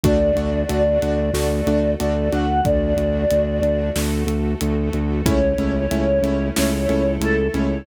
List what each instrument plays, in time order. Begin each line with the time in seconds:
0.04 synth bass 2 D2, string ensemble 1 A3 D4 F#4, acoustic grand piano A3 D4 F#4, choir aahs D5, kick, closed hi-hat
0.36 synth bass 2 D2, acoustic grand piano A3 D4 F#4, closed hi-hat
0.69 synth bass 2 D2, acoustic grand piano A3 D4 F#4, closed hi-hat
1.02 synth bass 2 D2, acoustic grand piano A3 D4 F#4, closed hi-hat
1.34 synth bass 2 D2, acoustic grand piano A3 D4 F#4, string ensemble 1 A3 F#4 A4, choir aahs D5, snare
1.67 synth bass 2 D2, acoustic grand piano A3 D4 F#4, closed hi-hat
1.99 synth bass 2 D2, acoustic grand piano A3 D4 F#4, choir aahs D5, closed hi-hat
2.32 synth bass 2 D2, acoustic grand piano A3 D4 F#4, choir aahs F#5, closed hi-hat
2.65 synth bass 2 D2, string ensemble 1 A3 D4 F#4, choir aahs D5, kick, closed hi-hat
2.97 synth bass 2 D2, closed hi-hat
3.31 synth bass 2 D2, closed hi-hat
3.62 synth bass 2 D2, closed hi-hat
3.96 synth bass 2 D2, string ensemble 1 A3 F#4 A4, snare
4.26 synth bass 2 D2, closed hi-hat
4.61 synth bass 2 D2, closed hi-hat
4.93 synth bass 2 D2, closed hi-hat
5.25 synth bass 2 C#2, acoustic grand piano A3 C#4 E4, string ensemble 1 A3 C#4 E4, choir aahs C#5, kick, closed hi-hat
5.58 synth bass 2 C#2, acoustic grand piano A3 C#4 E4, closed hi-hat
5.91 synth bass 2 C#2, acoustic grand piano A3 C#4 E4, closed hi-hat
6.22 synth bass 2 C#2, acoustic grand piano A3 C#4 E4, closed hi-hat
6.56 synth bass 2 C#2, string ensemble 1 A3 E4 A4, acoustic grand piano A3 C#4 E4, choir aahs C#5, snare
6.89 synth bass 2 C#2, acoustic grand piano A3 C#4 E4, closed hi-hat
7.20 synth bass 2 C#2, acoustic grand piano A3 C#4 E4, choir aahs A4, closed hi-hat
7.54 synth bass 2 C#2, acoustic grand piano A3 C#4 E4, choir aahs C#5, closed hi-hat